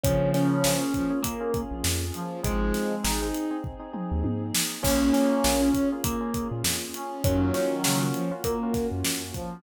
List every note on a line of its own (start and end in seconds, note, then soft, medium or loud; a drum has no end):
0.04 0.32 A#1 loud
0.04 0.83 C#3 medium
0.04 0.83 F3 medium
0.04 2.42 A#3 medium
0.04 0.55 A#3 medium
0.04 0.29 C#4 loud
0.04 2.42 C#4 medium
0.04 0.55 C#4 medium
0.04 2.42 F4 medium
0.04 0.55 F4 medium
0.04 2.42 G#4 medium
0.04 0.55 G#4 medium
0.04 0.29 C#5 loud
0.04 kick loud
0.04 closed hi-hat loud
0.34 1.19 C#4 loud
0.34 1.19 C#5 loud
0.34 snare medium
0.34 closed hi-hat medium
0.64 0.92 A#1 loud
0.64 0.79 A#3 medium
0.64 0.79 C#4 medium
0.64 0.79 F4 medium
0.64 0.79 G#4 medium
0.64 snare loud
0.81 1.04 A#3 medium
0.81 1.04 C#4 medium
0.81 1.04 F4 medium
0.81 1.04 G#4 medium
0.94 1.10 F3 medium
0.94 kick medium
0.94 closed hi-hat medium
1.10 1.33 A#3 medium
1.10 1.33 C#4 medium
1.10 1.33 F4 medium
1.10 1.33 G#4 medium
1.23 1.61 A#3 medium
1.23 1.61 A#4 medium
1.23 kick medium
1.23 closed hi-hat loud
1.41 1.51 A#3 medium
1.41 1.51 C#4 medium
1.41 1.51 F4 medium
1.41 1.51 G#4 medium
1.54 2.04 A#3 medium
1.54 2.04 C#4 medium
1.54 2.04 F4 medium
1.54 2.04 G#4 medium
1.54 kick loud
1.54 closed hi-hat medium
1.71 1.83 A#1 loud
1.84 2.12 F2 loud
1.84 snare loud
2.14 2.41 F3 medium
2.14 closed hi-hat medium
2.43 2.72 G#1 loud
2.43 2.95 F3 medium
2.43 2.95 G#3 medium
2.43 3.27 G#3 medium
2.43 2.93 C4 loud
2.43 4.82 C4 medium
2.43 2.93 D#4 medium
2.43 4.82 D#4 medium
2.43 2.93 G#4 medium
2.43 4.82 G#4 medium
2.43 3.27 G#4 loud
2.43 kick loud
2.43 closed hi-hat loud
2.74 snare medium
2.74 closed hi-hat medium
3.04 3.32 G#1 loud
3.04 3.17 C4 medium
3.04 3.17 D#4 medium
3.04 3.57 D#4 medium
3.04 3.17 G#4 medium
3.04 snare loud
3.22 3.45 C4 medium
3.22 3.45 D#4 medium
3.22 3.45 G#4 medium
3.35 closed hi-hat medium
3.51 3.74 C4 medium
3.51 3.74 D#4 medium
3.51 3.74 G#4 medium
3.64 kick medium
3.80 3.90 C4 medium
3.80 3.90 D#4 medium
3.80 3.90 G#4 medium
3.93 4.43 C4 medium
3.93 4.43 D#4 medium
3.93 4.43 G#4 medium
3.93 mid tom medium
4.12 4.23 D#2 loud
4.24 4.52 G#2 medium
4.24 high tom medium
4.54 snare loud
4.83 5.12 A#1 loud
4.83 5.32 A#3 medium
4.83 7.22 A#3 medium
4.83 5.69 A#3 medium
4.83 5.32 C#4 medium
4.83 5.10 C#4 loud
4.83 7.22 C#4 medium
4.83 5.69 C#4 medium
4.83 5.32 F4 medium
4.83 7.22 F4 medium
4.83 5.32 G#4 loud
4.83 7.22 G#4 medium
4.83 5.10 C#5 loud
4.83 kick loud
4.83 crash loud
5.13 5.89 C#4 medium
5.13 5.89 C#5 loud
5.13 snare medium
5.13 closed hi-hat medium
5.44 5.72 A#1 loud
5.44 5.58 A#3 medium
5.44 5.58 C#4 medium
5.44 5.58 F4 medium
5.44 5.58 G#4 medium
5.44 snare loud
5.62 5.85 A#3 medium
5.62 5.85 C#4 medium
5.62 5.85 F4 medium
5.62 5.85 G#4 medium
5.74 5.91 C#4 medium
5.74 kick medium
5.74 closed hi-hat medium
5.92 6.15 A#3 medium
5.92 6.15 C#4 medium
5.92 6.15 F4 medium
5.92 6.15 G#4 medium
6.04 6.48 A#3 medium
6.04 6.48 A#4 medium
6.04 kick loud
6.04 closed hi-hat loud
6.21 6.31 A#3 medium
6.21 6.31 C#4 medium
6.21 6.31 F4 medium
6.21 6.31 G#4 medium
6.34 6.84 A#3 medium
6.34 6.84 C#4 medium
6.34 6.84 F4 medium
6.34 6.84 G#4 medium
6.34 kick medium
6.34 closed hi-hat medium
6.51 6.63 A#2 loud
6.64 6.92 F2 loud
6.64 snare loud
6.94 7.23 C#4 medium
6.94 closed hi-hat medium
7.24 7.52 F#2 loud
7.24 8.07 D#3 medium
7.24 8.07 F#3 medium
7.24 9.62 A#3 medium
7.24 7.75 A#3 medium
7.24 9.62 C#4 medium
7.24 7.53 C#4 medium
7.24 7.75 C#4 medium
7.24 9.62 F4 medium
7.24 7.75 F4 loud
7.24 9.62 F#4 medium
7.24 7.75 F#4 loud
7.24 7.53 C#5 loud
7.24 kick loud
7.24 closed hi-hat loud
7.54 8.32 C#4 medium
7.54 8.32 C#5 loud
7.54 snare medium
7.54 closed hi-hat medium
7.84 8.12 C#3 medium
7.84 7.98 A#3 medium
7.84 7.98 C#4 medium
7.84 7.98 F4 medium
7.84 7.98 F#4 medium
7.84 snare loud
8.00 8.23 A#3 medium
8.00 8.23 C#4 medium
8.00 8.23 F4 medium
8.00 8.23 F#4 medium
8.14 8.30 F3 medium
8.14 closed hi-hat medium
8.31 8.54 A#3 medium
8.31 8.54 C#4 medium
8.31 8.54 F4 medium
8.31 8.54 F#4 medium
8.44 8.87 A#3 medium
8.44 8.87 A#4 loud
8.44 kick medium
8.44 closed hi-hat loud
8.63 8.72 A#3 medium
8.63 8.72 C#4 medium
8.63 8.72 F4 medium
8.63 8.72 F#4 medium
8.73 9.22 A#3 medium
8.73 9.22 C#4 medium
8.73 9.22 F4 medium
8.73 9.22 F#4 medium
8.73 kick medium
8.73 snare soft
8.73 closed hi-hat medium
8.91 9.03 F#2 loud
9.04 9.32 F#2 loud
9.04 snare loud
9.34 9.60 F3 medium
9.34 kick medium
9.34 closed hi-hat medium